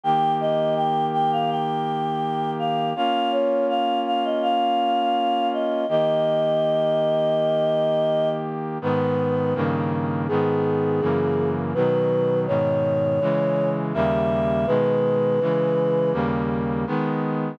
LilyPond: <<
  \new Staff \with { instrumentName = "Choir Aahs" } { \time 4/4 \key aes \major \tempo 4 = 82 g''8 ees''8 g''8 g''16 f''16 g''4. f''8 | f''8 des''8 f''8 f''16 ees''16 f''4. ees''8 | ees''2.~ ees''8 r8 | \key gis \minor b'4 r4 gis'2 |
b'4 cis''2 e''4 | b'2 r2 | }
  \new Staff \with { instrumentName = "Brass Section" } { \time 4/4 \key aes \major <ees bes g'>1 | <bes des' f'>1 | <ees bes g'>1 | \key gis \minor <gis, dis b>4 <g, cis dis ais>4 <gis, dis b>4 <fis, cis e ais>4 |
<b, dis fis>4 <gis, b, dis>4 <cis e gis>4 <dis, cis g ais>4 | <b, dis gis>4 <cis e gis>4 <dis, cis g ais>4 <dis gis b>4 | }
>>